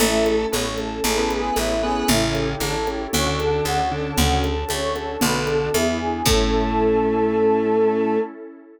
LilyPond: <<
  \new Staff \with { instrumentName = "Choir Aahs" } { \time 4/4 \key a \major \tempo 4 = 115 e'8 a'8 cis''8 a'8 a'8 gis'8 e'8 gis'8 | e'8 g'8 a'8 g'8 cis''8 a'8 fis'8 a'8 | fis'8 a'8 cis''8 a'8 b'8 a'8 e'8 gis'8 | a'1 | }
  \new Staff \with { instrumentName = "Lead 1 (square)" } { \time 4/4 \key a \major <a a'>4 <b b'>16 r4 <b b'>4~ <b b'>16 <b b'>8 | <cis cis'>4 <d d'>16 r4 <d d'>4~ <d d'>16 <d d'>8 | <cis cis'>8 r4. <d d'>4 r4 | a1 | }
  \new Staff \with { instrumentName = "Electric Piano 1" } { \time 4/4 \key a \major <cis' e' a'>4. <cis' e' a'>8 <cis' e' gis' a'>4. <cis' e' gis' a'>8 | <cis' e' g' a'>4. <cis' e' g' a'>8 <cis' d' fis' a'>4. <cis' d' fis' a'>8 | <cis' d' fis' a'>4. <cis' d' fis' a'>8 <b d' fis' a'>4 <b d' e' gis'>4 | <cis' e' a'>1 | }
  \new Staff \with { instrumentName = "Electric Bass (finger)" } { \clef bass \time 4/4 \key a \major a,,4 a,,4 a,,4 a,,4 | a,,4 a,,4 d,4 d,4 | d,4 d,4 b,,4 e,4 | a,1 | }
  \new Staff \with { instrumentName = "Pad 2 (warm)" } { \time 4/4 \key a \major <cis' e' a'>4 <a cis' a'>4 <cis' e' gis' a'>4 <cis' e' a' cis''>4 | <cis' e' g' a'>4 <cis' e' a' cis''>4 <cis' d' fis' a'>4 <cis' d' a' cis''>4 | <cis' d' fis' a'>4 <cis' d' a' cis''>4 <b d' fis' a'>4 <b d' e' gis'>4 | <cis' e' a'>1 | }
  \new DrumStaff \with { instrumentName = "Drums" } \drummode { \time 4/4 cgl8 cgho8 cgho8 cgho8 cgl8 cgho8 cgho4 | cgl8 cgho8 cgho8 cgho8 cgl8 cgho8 cgho4 | cgl8 cgho8 cgho8 cgho8 cgl8 cgho8 cgho4 | <cymc bd>4 r4 r4 r4 | }
>>